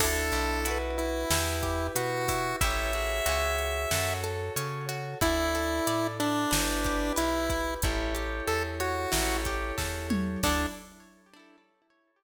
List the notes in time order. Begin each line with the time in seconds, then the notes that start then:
0.00 D2 D4 E4 A4, kick, crash
0.06 A4
0.32 B1, closed hi-hat
0.65 E4 F#4 B4, closed hi-hat
0.71 B4
0.98 E4, closed hi-hat
1.30 E2 E4 G4 B4, snare
1.63 G4, kick, closed hi-hat
1.95 B2 F#4 B4, closed hi-hat
2.28 E4, kick, open hi-hat
2.61 A1 E4 G4 A4 C#5 E5, kick, closed hi-hat
2.67 A4 C#5
2.93 F#4 G#4 C#5, closed hi-hat
3.26 C#2 F#4 G#4, closed hi-hat
3.32 C#5
3.58 closed hi-hat
3.91 F#2 F#4 A4 C#5, snare
4.24 A4, closed hi-hat
4.56 C#3 C#5, closed hi-hat
4.89 F#4, closed hi-hat
5.21 D2 E4 A4 D5, kick, closed hi-hat
5.55 A4, closed hi-hat
5.87 A2 D5, closed hi-hat
6.20 D4 E4, closed hi-hat
6.51 G1 E4 G4 B4, snare
6.84 G4, kick, closed hi-hat
7.16 B1 E4 B4, closed hi-hat
7.50 E4, kick, closed hi-hat
7.82 A1 E4 G4 A4 C#5, kick, closed hi-hat
8.15 G4, closed hi-hat
8.47 E2 A4, closed hi-hat
8.80 F#4 C#5, closed hi-hat
9.12 A1 E4 G4 A4 C#5, snare
9.45 G4, kick, closed hi-hat
9.78 E2 A4, kick, snare
10.10 C#5, mid tom
10.43 D2 D4 E4 A4, kick, crash
10.49 A4